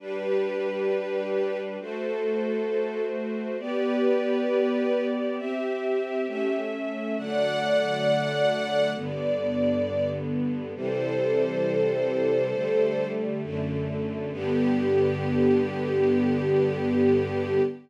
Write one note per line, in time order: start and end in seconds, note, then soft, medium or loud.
0.00 1.77 G3 medium
0.00 1.77 D4 medium
0.00 1.59 G4 medium
0.00 1.59 B4 medium
0.00 1.77 B4 medium
1.80 3.57 A3 medium
1.80 3.57 F#4 medium
1.80 3.03 A4 medium
1.80 3.57 C5 medium
3.59 5.36 B3 medium
3.59 5.36 G4 medium
3.59 5.04 G4 medium
3.59 5.04 B4 medium
3.59 5.36 D5 medium
5.37 6.26 C4 medium
5.37 6.26 G4 medium
5.37 6.61 G4 medium
5.37 6.26 E5 medium
6.27 7.16 A3 medium
6.27 7.16 C#4 medium
6.27 7.16 E5 medium
7.17 8.94 D3 medium
7.17 8.94 F#3 medium
7.17 8.94 A3 medium
7.17 8.90 D5 medium
7.17 8.90 F#5 medium
8.95 10.73 G2 medium
8.95 10.73 D3 medium
8.95 10.73 B3 medium
8.95 10.09 D5 medium
10.75 12.52 C3 medium
10.75 12.52 E3 medium
10.75 12.52 G3 medium
10.75 13.07 A4 medium
10.75 13.07 C5 medium
12.54 13.42 D3 medium
12.54 13.42 G3 medium
12.54 13.42 A3 medium
13.43 14.32 F#2 medium
13.43 14.31 D3 medium
13.43 14.32 A3 medium
14.32 17.60 G2 loud
14.32 17.60 D3 medium
14.32 17.60 B3 loud
14.32 17.61 G4 loud